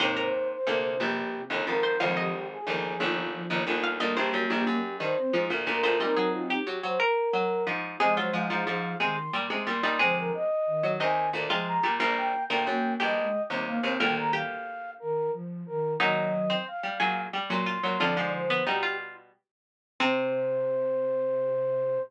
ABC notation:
X:1
M:12/8
L:1/8
Q:3/8=120
K:Cm
V:1 name="Flute"
z c2 c3 G3 z B2 | z G2 A3 F3 z F2 | z G2 G3 c3 z B2 | B2 F G2 c B4 z2 |
e c f4 c'2 z2 c'2 | c B e4 a2 z2 b2 | z g2 g3 e3 z f2 | g b f4 B2 z2 B2 |
e4 f4 z c'3 | d2 c2 G2 z6 | c12 |]
V:2 name="Harpsichord"
c B z9 c | f e z9 f | e c z9 c | e A2 G3 B2 z4 |
A F z9 E | A2 z4 e3 F3 | B,3 B z2 G6 | B2 G4 z6 |
E2 z C z2 A2 z2 F2 | F3 =B, E F2 z5 | C12 |]
V:3 name="Flute"
[A,,C,]2 z2 C,4 C,2 z2 | [D,F,]2 z2 F,4 F,2 z2 | [G,B,]5 z2 C F z2 F | [CE]4 z8 |
[F,A,]4 F,2 E,2 z4 | [D,F,]2 z2 E,5 F,2 B, | z4 B,2 G, A, z G, B, C | [E,G,]3 z3 E,2 F,2 E,2 |
[E,_G,]4 z8 | [D,F,]4 z8 | C,12 |]
V:4 name="Harpsichord" clef=bass
[E,,C,]4 [D,,B,,]2 [B,,,G,,]3 [G,,,E,,] [A,,,F,,]2 | [A,,,F,,]4 [G,,,E,,]2 [G,,,E,,]3 [G,,,E,,] [G,,,E,,]2 | [D,,B,,] [B,,,G,,] ^F,, [B,,,G,,] _G,,2 [=G,,E,] z [A,,=F,] [D,,B,,] [D,,B,,] [D,,B,,] | [B,,G,] _G,3 G, G, z2 G,2 [A,,F,]2 |
[C,A,] _G, [A,,F,] [A,,F,] [A,,F,]2 [C,A,] z [B,,=G,] [C,A,] [B,,G,] [B,,G,] | [C,A,]3 z2 _G, [E,,C,]2 [D,,B,,] [C,A,]2 [B,,=G,] | [B,,,G,,]2 z [D,,B,,] ^F,,2 [B,,,G,,]2 z [E,,C,]2 [E,,C,] | [D,,B,,]6 z6 |
[B,,_G,]3 z2 =G, [B,,_G,]2 =G, [B,,_G,]2 [B,,G,] | [F,,D,] [A,,F,]3 [=B,,G,]4 z4 | C,12 |]